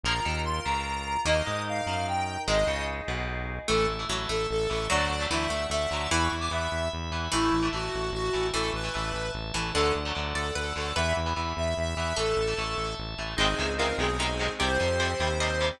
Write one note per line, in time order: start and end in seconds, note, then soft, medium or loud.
0.04 0.21 A#1 loud
0.04 0.13 F3 loud
0.04 0.13 A#3 loud
0.04 1.25 F4 medium
0.04 1.15 F4 medium
0.04 1.25 A#4 medium
0.04 1.15 A#4 medium
0.04 0.63 A#4 medium
0.04 0.40 A#5 loud
0.25 0.60 D#2 medium
0.25 0.60 D#3 medium
0.45 0.64 C6 medium
0.65 1.17 C#2 medium
0.65 1.17 C#3 medium
0.65 1.20 A#5 medium
1.25 1.42 D#2 medium
1.25 1.34 D#3 loud
1.25 2.31 A#3 medium
1.25 1.34 A#3 loud
1.25 2.46 D#4 loud
1.25 2.36 D#4 medium
1.25 2.46 A#4 medium
1.25 2.36 A#4 medium
1.25 1.62 D#5 loud
1.46 1.82 G#2 medium
1.46 1.81 G#3 medium
1.68 2.06 F5 medium
1.87 2.38 F#2 medium
1.87 2.39 F#3 medium
2.08 2.41 G5 medium
2.47 2.65 G#1 loud
2.47 2.56 D#3 loud
2.47 3.37 G#3 medium
2.47 2.56 G#3 loud
2.47 3.67 D#4 medium
2.47 3.58 D#4 medium
2.47 3.67 G#4 medium
2.47 3.58 G#4 medium
2.47 2.84 D#5 loud
2.67 3.01 C#2 medium
2.67 3.02 C#3 medium
3.08 3.60 B1 medium
3.08 3.60 B2 medium
3.68 3.87 A1 medium
3.68 3.93 E3 medium
3.68 4.02 A3 medium
3.68 3.93 A3 medium
3.68 3.86 A4 loud
3.68 4.88 E5 medium
3.68 4.88 A5 medium
3.88 4.05 A1 medium
3.99 4.07 E3 medium
3.99 4.07 A3 medium
4.09 4.26 A1 medium
4.09 4.41 E3 medium
4.09 4.28 F#3 medium
4.09 4.41 A3 medium
4.29 4.47 A1 medium
4.29 4.65 A3 medium
4.29 4.46 A4 medium
4.51 4.68 A1 medium
4.51 4.69 A4 loud
4.69 4.88 A1 medium
4.69 4.86 E3 medium
4.69 4.86 A3 medium
4.69 4.87 A4 loud
4.90 5.09 D2 medium
4.90 5.14 D3 medium
4.90 5.23 F#3 medium
4.90 5.14 F#3 medium
4.90 5.14 A3 medium
4.90 5.24 D5 loud
4.90 6.10 D5 medium
4.90 6.10 F#5 medium
4.90 6.10 A5 medium
5.10 5.27 D2 medium
5.20 5.28 D3 medium
5.20 5.28 F#3 medium
5.20 5.28 A3 medium
5.30 5.48 D2 medium
5.30 5.63 D3 medium
5.30 5.48 E3 medium
5.30 5.63 F#3 medium
5.30 5.63 A3 medium
5.30 5.67 E5 loud
5.50 5.67 D2 medium
5.50 5.67 A3 medium
5.70 5.87 D2 medium
5.70 6.09 A3 medium
5.70 6.10 E5 loud
5.91 6.08 D2 medium
5.91 6.07 D3 medium
5.91 6.07 F#3 medium
5.91 6.07 A3 medium
6.11 6.29 E2 loud
6.11 6.36 E3 medium
6.11 7.22 E3 medium
6.11 6.36 B3 medium
6.11 7.31 E5 medium
6.11 6.21 B5 loud
6.11 7.31 B5 medium
6.21 6.31 C#6 loud
6.32 6.49 E2 medium
6.40 6.49 E3 medium
6.40 6.49 B3 medium
6.40 6.50 D6 loud
6.51 6.68 E2 medium
6.51 6.84 E3 medium
6.51 6.84 B3 medium
6.51 6.88 E5 medium
6.72 6.89 E2 medium
6.93 7.11 E2 medium
7.11 7.29 E2 medium
7.11 7.28 E3 medium
7.11 7.28 B3 medium
7.32 7.50 A1 medium
7.32 7.85 E3 medium
7.32 7.57 E3 medium
7.32 7.57 A3 medium
7.32 7.67 E4 loud
7.32 8.52 E5 medium
7.32 8.52 A5 medium
7.53 7.70 A1 medium
7.63 7.71 E3 medium
7.63 7.71 A3 medium
7.73 7.90 A1 medium
7.73 8.05 E3 medium
7.73 8.05 A3 medium
7.73 8.10 F#4 medium
7.94 8.12 A1 medium
8.12 8.30 A1 medium
8.12 8.47 F#4 loud
8.33 8.52 A1 medium
8.33 8.49 E3 medium
8.33 8.49 A3 medium
8.54 8.71 A1 medium
8.54 8.78 E3 medium
8.54 9.40 E3 medium
8.54 8.78 A3 medium
8.54 8.70 A4 loud
8.54 9.74 E5 medium
8.54 9.74 A5 medium
8.73 8.90 A1 medium
8.73 9.31 B4 loud
8.84 8.92 E3 medium
8.84 8.92 A3 medium
8.94 9.13 A1 medium
8.94 9.26 E3 medium
8.94 9.26 A3 medium
9.13 9.31 A1 medium
9.35 9.52 A1 medium
9.54 9.72 A1 medium
9.54 9.73 E3 medium
9.54 9.71 E3 medium
9.54 9.71 A3 medium
9.74 9.92 D2 medium
9.74 9.99 D3 medium
9.74 9.99 F#3 medium
9.74 9.99 A3 medium
9.74 10.25 D4 medium
9.74 9.93 A4 loud
9.74 10.95 D5 medium
9.74 10.95 F#5 medium
9.74 10.95 A5 medium
9.95 10.13 D2 medium
10.05 10.13 D3 medium
10.05 10.13 F#3 medium
10.05 10.13 A3 medium
10.15 10.34 D2 medium
10.15 10.47 D3 medium
10.15 10.47 F#3 medium
10.15 10.47 A3 medium
10.35 10.52 D2 medium
10.35 10.53 A4 loud
10.35 10.55 D5 medium
10.55 10.73 D2 medium
10.55 10.74 A4 loud
10.55 10.95 B4 medium
10.76 10.93 D2 medium
10.76 10.92 D3 medium
10.76 10.92 F#3 medium
10.76 10.92 A3 medium
10.76 10.94 A4 medium
10.96 11.13 E2 loud
10.96 11.20 E3 medium
10.96 11.20 B3 medium
10.96 12.07 B4 medium
10.96 11.13 E5 loud
10.96 12.16 E5 medium
10.96 12.17 B5 medium
11.16 11.34 E2 medium
11.26 11.34 E3 medium
11.26 11.34 B3 medium
11.36 11.54 E2 medium
11.36 11.69 E3 medium
11.36 11.69 B3 medium
11.57 11.74 E2 medium
11.57 11.76 E5 medium
11.77 11.95 E2 medium
11.77 11.96 E5 loud
11.96 12.13 E2 medium
11.96 12.13 E3 medium
11.96 12.13 B3 medium
11.96 12.15 E5 loud
12.16 12.34 A1 medium
12.16 12.42 E3 medium
12.16 12.42 A3 medium
12.16 12.66 A4 medium
12.16 12.94 A4 loud
12.16 13.36 E5 medium
12.16 13.36 A5 medium
12.37 12.54 A1 medium
12.47 12.55 E3 medium
12.47 12.55 A3 medium
12.58 12.75 A1 medium
12.58 12.90 E3 medium
12.58 12.90 A3 medium
12.77 12.95 A1 medium
12.98 13.16 A1 medium
13.18 13.35 A1 medium
13.18 13.35 E3 medium
13.18 13.35 A3 medium
13.37 13.55 G#1 loud
13.37 13.46 C3 loud
13.37 13.46 D#3 loud
13.37 13.46 G#3 loud
13.37 13.91 C4 medium
13.37 13.98 C4 loud
13.37 13.91 D#4 medium
13.37 13.73 D#4 medium
13.37 13.98 D#4 loud
13.37 13.91 G#4 medium
13.37 13.73 G#4 loud
13.37 13.98 G#4 medium
13.59 13.94 C#2 medium
13.59 13.67 C3 medium
13.59 13.67 D#3 medium
13.59 13.67 G#3 medium
13.78 13.87 C3 medium
13.78 13.87 D#3 medium
13.78 13.87 G#3 medium
13.78 14.17 F4 medium
13.78 13.97 A#4 medium
13.98 14.49 B1 loud
13.98 14.07 C3 medium
13.98 14.07 D#3 medium
13.98 14.59 G#3 medium
13.98 14.07 G#3 medium
13.98 14.53 C4 medium
13.98 14.59 C4 medium
13.98 14.53 D#4 medium
13.98 14.53 G#4 medium
13.98 14.59 G#4 medium
13.98 14.52 G#4 medium
14.19 14.27 C3 medium
14.19 14.27 D#3 medium
14.19 14.27 G#3 medium
14.19 14.54 D#4 medium
14.39 14.47 C3 medium
14.39 14.47 D#3 medium
14.39 14.47 G#3 medium
14.59 14.78 C2 loud
14.59 14.68 C3 loud
14.59 14.68 G3 medium
14.59 15.13 C4 medium
14.59 15.80 C4 loud
14.59 15.13 G4 medium
14.59 15.80 G4 loud
14.59 14.93 G4 medium
14.59 15.66 C5 loud
14.80 15.15 F2 loud
14.80 14.88 C3 medium
14.80 14.88 G3 medium
15.00 15.08 C3 medium
15.00 15.08 G3 medium
15.00 15.36 C5 medium
15.20 15.71 D#2 medium
15.20 15.28 C3 medium
15.20 15.28 G3 medium
15.20 15.76 C4 medium
15.20 15.76 G4 medium
15.40 15.48 C3 medium
15.40 15.48 G3 medium
15.40 15.73 D#5 medium
15.61 15.69 C3 medium
15.61 15.69 G3 medium